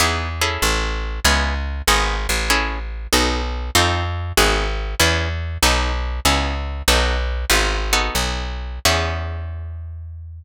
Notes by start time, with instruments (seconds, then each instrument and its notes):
0.00 electric bass (finger) E2, acoustic guitar (steel) B3 D#4 E4 G#4
0.41 acoustic guitar (steel) C#4 E4 G#4 A4
0.62 electric bass (finger) A1
1.25 electric bass (finger) C#2, acoustic guitar (steel) B3 C#4 E4 G#4
1.88 electric bass (finger) G#1, acoustic guitar (steel) B3 D#4 F#4 G#4
2.29 electric bass (finger) A1
2.50 acoustic guitar (steel) C#4 E4 G#4 A4
3.13 electric bass (finger) B1, acoustic guitar (steel) B3 D#4 F#4 A4
3.75 electric bass (finger) F2, acoustic guitar (steel) C4 D#4 F4 A4
4.37 electric bass (finger) G#1, acoustic guitar (steel) B3 D#4 F#4 G#4
5.00 electric bass (finger) E2, acoustic guitar (steel) B3 C#4 E4 G#4
5.63 electric bass (finger) B1, acoustic guitar (steel) B3 D#4 F#4 A4
6.25 electric bass (finger) C#2, acoustic guitar (steel) B3 C#4 E4 G#4
6.88 electric bass (finger) B1, acoustic guitar (steel) B3 D#4 F#4 A4
7.50 electric bass (finger) G#1, acoustic guitar (steel) B3 D#4 F4 G#4
7.93 acoustic guitar (steel) B3 D#4 F#4 A4
8.15 electric bass (finger) B1
8.85 electric bass (finger) E2, acoustic guitar (steel) B3 C#4 E4 G#4